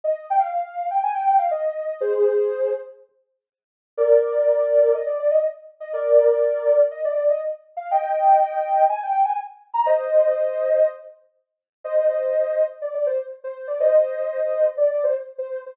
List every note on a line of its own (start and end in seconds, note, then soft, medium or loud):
0.04 0.25 D#5 medium
0.30 0.42 G5 medium
0.39 0.87 F5 medium
0.90 1.02 G5 medium
1.03 1.15 G#5 medium
1.14 1.38 G5 loud
1.38 1.50 F5 medium
1.51 1.98 D#5 medium
2.01 2.73 G#4 loud
2.01 2.73 C5 loud
3.97 4.92 A#4 loud
3.97 4.92 D5 loud
4.94 5.06 D#5 medium
5.06 5.18 D5 medium
5.19 5.31 D5 loud
5.31 5.43 D#5 loud
5.80 5.92 D#5 medium
5.93 6.80 A#4 loud
5.93 6.80 D5 loud
6.91 7.03 D#5 medium
7.05 7.16 D5 loud
7.16 7.28 D5 medium
7.29 7.41 D#5 medium
7.77 7.88 F5 medium
7.91 8.82 D#5 medium
7.91 8.82 G5 loud
8.89 9.01 G#5 loud
9.03 9.11 G5 medium
9.12 9.23 G5 medium
9.25 9.36 G#5 medium
9.74 9.85 A#5 loud
9.86 10.87 C5 loud
9.86 10.87 D#5 loud
11.84 12.63 C5 medium
11.84 12.63 D#5 loud
12.82 12.93 D5 medium
12.94 13.06 D5 medium
13.06 13.18 C5 loud
13.44 13.67 C5 medium
13.67 13.79 D5 medium
13.80 14.65 C5 medium
13.80 14.65 D#5 loud
14.77 14.89 D5 medium
14.90 15.02 D5 loud
15.04 15.15 C5 medium
15.38 15.61 C5 medium
15.66 15.77 C5 medium